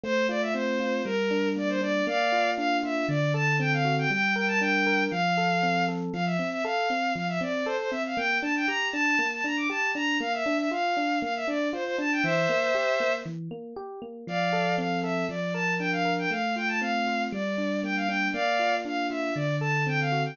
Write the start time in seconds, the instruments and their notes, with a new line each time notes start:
0.03 electric piano 1 A3, violin C5
0.29 electric piano 1 F4, violin D5
0.42 violin E5
0.53 electric piano 1 C4, violin C5
0.80 electric piano 1 F4
1.05 electric piano 1 G3, violin A#4
1.31 electric piano 1 D4
1.56 electric piano 1 A#3, violin D5
1.69 violin C5
1.81 electric piano 1 D4, violin D5
2.07 electric piano 1 A#3, violin D5 F5
2.32 electric piano 1 F4
2.57 electric piano 1 D4, violin F5
2.83 electric piano 1 F4, violin E5
3.09 electric piano 1 D3, violin D5
3.34 electric piano 1 A4, violin A5
3.59 electric piano 1 C4, violin G5
3.73 violin F5
3.85 electric piano 1 F#4
3.99 violin G5
4.10 electric piano 1 G3, violin G5
4.35 electric piano 1 A#4, violin G5
4.48 violin A5
4.60 electric piano 1 D4, violin G5
4.87 electric piano 1 A#4
5.11 electric piano 1 F3, violin F5
5.37 electric piano 1 A4
5.63 electric piano 1 C4
5.88 electric piano 1 A4
6.13 electric piano 1 F3, violin F5
6.25 violin E5
6.39 electric piano 1 C4
6.52 violin E5
6.64 electric piano 1 A4, violin F5
6.90 electric piano 1 C4
7.15 electric piano 1 F3, violin F5
7.29 violin E5
7.41 electric piano 1 C4, violin D5
7.65 electric piano 1 A4, violin C5
7.79 violin C5
7.91 electric piano 1 C4, violin E5
8.06 violin F5
8.17 electric piano 1 A#3, violin G5
8.42 electric piano 1 D4, violin A5
8.56 violin G5
8.67 electric piano 1 G4, violin A#5
8.92 electric piano 1 D4, violin A5
9.19 electric piano 1 A#3
9.33 violin A5
9.44 electric piano 1 D4, violin A#5
9.57 violin D6
9.70 electric piano 1 G4, violin A5
9.95 electric piano 1 D4, violin A#5
10.20 electric piano 1 A#3, violin F5
10.33 violin E5
10.46 electric piano 1 D4
10.58 violin E5
10.71 electric piano 1 F4, violin F5
10.97 electric piano 1 D4
11.22 electric piano 1 A#3, violin F5
11.36 violin E5
11.48 electric piano 1 D4, violin D5
11.73 electric piano 1 F4, violin C5
11.85 violin C5
11.98 electric piano 1 D4, violin A5
12.12 violin G5
12.23 electric piano 1 E3, violin C5 E5
12.49 electric piano 1 A#3
12.75 electric piano 1 G4
13.00 electric piano 1 A#3
13.26 electric piano 1 E3
13.51 electric piano 1 A#3
13.76 electric piano 1 G4
14.02 electric piano 1 A#3
14.27 electric piano 1 F3, violin D5 F5
14.53 electric piano 1 A4
14.78 electric piano 1 C4, violin F5
15.03 electric piano 1 A4, violin E5
15.29 electric piano 1 F3, violin D5
15.54 electric piano 1 A#4, violin A5
15.79 electric piano 1 D4, violin G5
15.92 violin F5
16.05 electric piano 1 A#4
16.19 violin G5
16.31 electric piano 1 A3, violin F5
16.56 electric piano 1 F4, violin G5
16.68 violin A5
16.81 electric piano 1 C4, violin F5
17.07 electric piano 1 F4
17.32 electric piano 1 G3, violin D5
17.58 electric piano 1 D4
17.83 electric piano 1 A#3, violin G5
17.96 violin F5
18.07 electric piano 1 D4, violin G5
18.33 electric piano 1 A#3, violin D5 F5
18.59 electric piano 1 F4
18.85 electric piano 1 D4, violin F5
19.10 electric piano 1 F4, violin E5
19.35 electric piano 1 D3, violin D5
19.60 electric piano 1 A4, violin A5
19.87 electric piano 1 C4, violin G5
20.00 violin F5
20.12 electric piano 1 F#4
20.25 violin G5